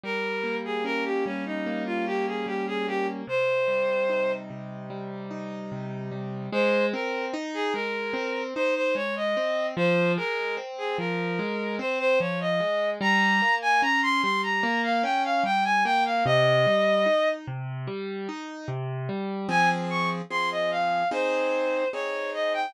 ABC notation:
X:1
M:4/4
L:1/16
Q:1/4=74
K:Ab
V:1 name="Violin"
B3 A B G D E2 F G A G A G z | c6 z10 | c2 B2 z A B4 c c d e3 | c2 B2 z A B4 c c d e3 |
b3 a b c' c' b2 f g f g a g f | e6 z10 | [K:Fm] a z d' z c' e f2 c4 d2 e g |]
V:2 name="Acoustic Grand Piano"
G,2 B,2 D2 G,2 B,2 D2 G,2 B,2 | C,2 G,2 E2 C,2 G,2 E2 C,2 G,2 | A,2 C2 E2 A,2 C2 E2 A,2 C2 | F,2 A,2 C2 F,2 A,2 C2 F,2 A,2 |
G,2 B,2 D2 G,2 B,2 D2 G,2 B,2 | C,2 G,2 E2 C,2 G,2 E2 C,2 G,2 | [K:Fm] [F,CA]4 [F,CA]4 [CEA]4 [CEA]4 |]